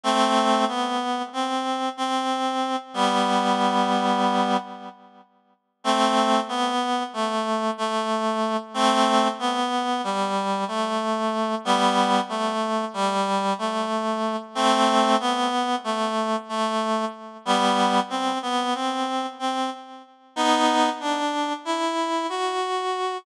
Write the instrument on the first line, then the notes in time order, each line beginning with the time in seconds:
clarinet
0.03 A3 C4
0.68 B3
1.33 C4
1.97 C4
2.94 G3 B3
5.84 A3 C4
6.49 B3
7.13 A3
7.78 A3
8.74 A3 C4
9.39 B3
10.04 G3
10.68 A3
11.65 G3 B3
12.29 A3
12.94 G3
13.58 A3
14.55 A3 C4
15.20 B3
15.84 A3
16.49 A3
17.45 G3 B3
18.10 C4
18.42 B3
18.74 C4
19.39 C4
20.36 B3 D#4
21.00 D4
21.65 E4
22.29 F#4